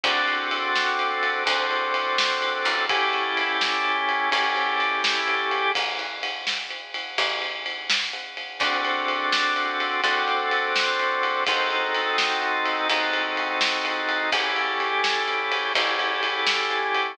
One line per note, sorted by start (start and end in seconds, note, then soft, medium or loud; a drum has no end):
0.03 1.35 D2 medium
0.03 1.44 C4 medium
0.03 1.44 D4 medium
0.03 1.44 F#4 loud
0.03 1.44 A4 medium
0.03 kick medium
0.03 ride medium
0.28 ride medium
0.51 ride medium
0.75 snare medium
0.99 ride medium
1.23 ride medium
1.45 2.60 D2 loud
1.45 2.85 C4 loud
1.45 2.85 D4 medium
1.45 2.85 F#4 medium
1.45 2.85 A4 medium
1.45 kick medium
1.45 ride medium
1.71 ride medium
1.94 ride medium
2.18 snare loud
2.42 ride medium
2.65 4.20 A1 medium
2.65 ride medium
2.89 4.29 C#4 loud
2.89 4.29 E4 loud
2.89 4.29 G4 loud
2.89 4.29 A4 medium
2.89 kick loud
2.89 ride medium
3.13 ride medium
3.37 ride medium
3.61 snare loud
3.85 ride medium
4.09 ride medium
4.31 5.64 A1 medium
4.31 5.71 C#4 loud
4.31 5.71 E4 medium
4.31 5.71 G4 loud
4.31 5.71 A4 loud
4.31 kick medium
4.31 ride medium
4.56 ride medium
4.80 ride medium
5.04 snare loud
5.28 ride medium
5.51 ride medium
5.75 7.07 A1 medium
5.75 kick medium
5.75 ride medium
5.99 ride medium
6.23 ride medium
6.47 snare medium
6.71 ride medium
6.94 ride medium
7.18 8.49 A1 medium
7.18 kick medium
7.18 ride medium
7.42 ride medium
7.66 ride medium
7.90 snare loud
8.13 ride medium
8.37 ride medium
8.60 9.91 D2 medium
8.60 10.01 C4 medium
8.60 10.01 D4 medium
8.60 10.01 F#4 loud
8.60 10.01 A4 loud
8.60 kick loud
8.60 ride medium
8.85 ride medium
9.08 ride medium
9.32 snare loud
9.56 ride medium
9.80 ride medium
10.03 11.35 D2 medium
10.03 11.44 C4 loud
10.03 11.44 D4 medium
10.03 11.44 F#4 loud
10.03 11.44 A4 loud
10.03 kick medium
10.03 ride medium
10.28 ride medium
10.51 ride medium
10.76 snare loud
11.00 ride medium
11.23 ride medium
11.47 12.79 D#2 medium
11.47 12.87 C4 loud
11.47 12.87 D#4 loud
11.47 12.87 F#4 medium
11.47 12.87 A4 loud
11.47 kick loud
11.47 ride loud
11.71 ride medium
11.95 ride medium
12.18 snare loud
12.42 ride medium
12.66 ride medium
12.89 14.21 D#2 medium
12.89 14.30 C4 medium
12.89 14.30 D#4 loud
12.89 14.30 F#4 medium
12.89 14.30 A4 loud
12.89 kick medium
12.89 ride medium
13.13 ride medium
13.37 ride medium
13.61 snare loud
13.85 ride medium
14.09 ride medium
14.32 15.64 A1 medium
14.32 15.72 C#4 medium
14.32 15.72 E4 medium
14.32 15.72 G4 medium
14.32 15.72 A4 medium
14.32 kick loud
14.32 ride loud
14.56 ride medium
14.80 ride medium
15.04 snare loud
15.28 ride medium
15.52 ride medium
15.75 17.07 A1 medium
15.75 17.16 C#4 medium
15.75 17.16 E4 loud
15.75 17.16 G4 medium
15.75 17.16 A4 medium
15.75 kick medium
15.75 ride medium
15.99 ride medium
16.23 ride medium
16.47 snare loud
16.70 ride medium
16.95 ride medium